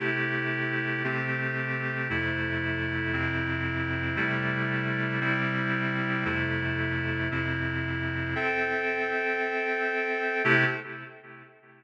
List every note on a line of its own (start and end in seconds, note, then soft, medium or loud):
0.00 1.02 C3 medium
0.00 1.02 A3 medium
0.00 1.02 E4 medium
0.00 1.02 G4 medium
1.04 2.08 C3 medium
1.04 2.08 A3 medium
1.04 2.08 C4 medium
1.04 2.08 G4 medium
2.10 3.12 F2 medium
2.10 3.12 C3 medium
2.10 3.13 A3 medium
2.10 3.12 E4 medium
3.13 4.17 F2 medium
3.13 4.16 C3 medium
3.13 4.17 C4 medium
3.13 4.16 E4 medium
4.16 5.20 C3 medium
4.16 5.20 G3 medium
4.16 5.20 A3 medium
4.16 5.20 E4 medium
5.21 6.24 C3 medium
5.21 6.24 G3 medium
5.21 6.24 C4 medium
5.21 6.24 E4 medium
6.25 7.29 F2 medium
6.25 7.29 C3 medium
6.25 7.29 A3 medium
6.25 7.29 E4 medium
7.31 8.35 F2 medium
7.31 8.35 C3 medium
7.31 8.35 C4 medium
7.31 8.35 E4 medium
8.35 10.42 C4 medium
8.35 10.42 A4 medium
8.35 10.42 E5 medium
8.35 10.42 G5 medium
10.44 10.64 C3 loud
10.44 10.64 A3 loud
10.44 10.64 E4 loud
10.44 10.64 G4 loud